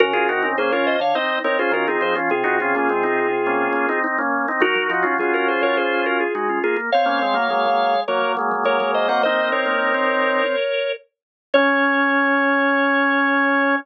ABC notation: X:1
M:4/4
L:1/16
Q:1/4=104
K:Db
V:1 name="Drawbar Organ"
[GB]4 [Ac] [Bd] [ce] [df] [ce]2 [Bd] [Ac] [GB] [FA] [Ac] z | [FA]12 z4 | [EG]4 [FA] [GB] [Ac] [Bd] [Ac]2 [GB] [FA] [EG] [DF] [FA] z | [df]8 [Bd]2 z2 [Bd]2 [ce] [eg] |
[ce]2 [Bd]10 z4 | d16 |]
V:2 name="Drawbar Organ"
z [FA] [EG] [CE] [B,D] [DF]2 z [CE]2 [CE] [DF] [DF] [CE]2 [DF] | z [EG] [DF] [B,D] [A,C] [CE]2 z [B,D]2 [B,D] [CE] [CE] [B,D]2 [CE] | [GB]2 [EG] [DF] [DF] [DF]7 z4 | z [B,D] [A,C] [G,B,] [G,B,] [G,B,]2 z [G,B,]2 [G,B,] [G,B,] [G,B,] [G,B,]2 [G,B,] |
[CE]10 z6 | D16 |]
V:3 name="Drawbar Organ"
D, D, C, D, D,3 =D, z4 E,2 F, F, | C, C, C, D, C,6 z6 | G, G, F, G, G,3 G, z4 A,2 B, B, | C3 B, A,4 G, G, A,2 A, A,2 C |
B,2 C B,2 C5 z6 | D16 |]